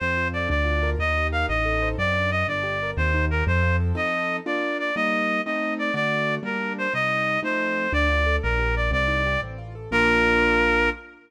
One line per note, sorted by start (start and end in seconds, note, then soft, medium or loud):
0.00 0.47 F2 medium
0.00 0.48 C4 medium
0.00 0.28 C5 medium
0.17 0.48 F4 medium
0.33 0.49 A4 medium
0.33 0.49 D5 medium
0.49 0.96 D2 medium
0.49 0.96 D4 medium
0.49 0.90 D5 medium
0.64 0.96 F4 medium
0.83 0.98 A#4 medium
0.99 1.45 D#2 medium
0.99 1.47 D#4 medium
0.99 1.27 D#5 medium
1.17 1.49 G4 medium
1.32 1.48 A#4 medium
1.32 1.46 F5 medium
1.49 1.95 A1 medium
1.49 1.96 D#4 medium
1.49 1.89 D#5 medium
1.65 1.97 A4 medium
1.82 1.98 C5 medium
1.98 2.44 F#2 loud
1.98 2.14 C4 medium
1.98 2.31 D5 medium
2.16 2.31 D4 medium
2.31 2.46 F#4 medium
2.31 2.47 D#5 medium
2.48 2.93 G1 loud
2.48 2.63 D4 medium
2.48 2.91 D5 medium
2.63 2.78 G4 medium
2.83 2.98 A#4 medium
2.97 3.43 D#2 loud
2.97 3.12 C4 medium
2.97 3.25 C5 medium
3.14 3.29 D#4 medium
3.31 3.46 G4 medium
3.31 3.44 A#4 medium
3.47 3.93 F2 loud
3.47 3.62 C4 medium
3.47 3.76 C5 medium
3.62 3.77 F4 medium
3.80 3.94 A4 medium
3.95 4.40 F3 medium
3.95 4.40 C4 medium
3.95 4.40 D#4 medium
3.95 4.40 A4 medium
3.95 4.37 D#5 medium
4.46 4.91 A#3 medium
4.46 4.91 D4 medium
4.46 4.91 F4 medium
4.46 4.77 D5 medium
4.79 4.95 D5 medium
4.96 5.41 G3 medium
4.96 5.41 A#3 medium
4.96 5.41 D#4 medium
4.96 5.41 D#5 medium
5.46 5.91 A3 medium
5.46 5.91 C4 medium
5.46 5.91 D#4 medium
5.46 5.74 D#5 medium
5.79 5.94 D5 medium
5.94 6.39 D3 medium
5.94 6.39 A3 medium
5.94 6.39 F#4 medium
5.94 6.35 D5 medium
6.43 6.87 G3 medium
6.43 6.87 A#3 medium
6.43 6.87 D4 medium
6.43 6.73 A#4 medium
6.78 6.93 C5 medium
6.94 7.38 C3 medium
6.94 7.38 G3 medium
6.94 7.38 D#4 medium
6.94 7.40 D#5 medium
7.43 7.87 F3 medium
7.43 7.87 A3 medium
7.43 7.87 C4 medium
7.43 7.87 D#4 medium
7.43 7.92 C5 medium
7.93 8.38 D2 loud
7.93 8.08 D4 medium
7.93 8.36 D5 medium
8.08 8.23 F4 medium
8.26 8.41 A4 medium
8.43 8.90 A#1 loud
8.43 8.60 D4 medium
8.43 8.75 A#4 medium
8.58 8.73 G4 medium
8.75 8.90 A#4 medium
8.75 8.91 D5 medium
8.91 9.37 C2 loud
8.91 9.07 C4 medium
8.91 9.40 D5 medium
9.08 9.23 D#4 medium
9.26 9.41 G4 medium
9.42 9.88 A1 loud
9.42 9.57 C4 medium
9.58 9.73 F4 medium
9.75 9.90 A4 medium
9.91 10.89 A#1 loud
9.91 10.90 A#3 loud
9.91 10.90 D4 medium
9.91 10.90 F4 loud
9.91 10.90 A#4 loud